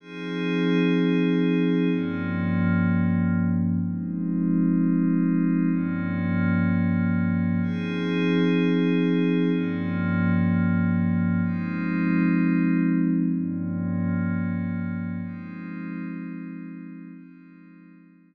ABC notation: X:1
M:4/4
L:1/8
Q:1/4=126
K:Fm
V:1 name="Pad 5 (bowed)"
[F,CEA]8 | [G,,F,B,D]8 | [F,A,CE]8 | [G,,F,B,D]8 |
[F,CEA]8 | [G,,F,B,D]8 | [F,A,CE]8 | [G,,F,B,D]8 |
[F,A,CE]8 | [F,A,CE]8 |]